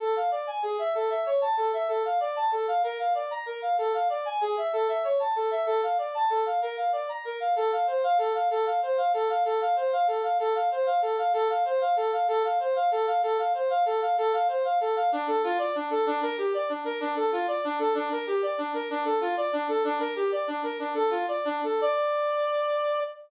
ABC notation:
X:1
M:6/8
L:1/8
Q:3/8=127
K:Dm
V:1 name="Brass Section"
A f d ^g ^G e | A e ^c a A e | A f d a A f | B f d b B f |
A f d ^g ^G e | A e ^c a A e | A f d a A f | B f d b B f |
[K:F] A f c f A f | A f c f A f | A f c f A f | A f c f A f |
A f c f A f | A f c f A f | A f c f A f | A f c f A f |
[K:Dm] D A F d D A | D B G d D B | D A F d D A | D B G d D B |
D A F d D A | D B G d D B | "^rit." D A F d D A | d6 |]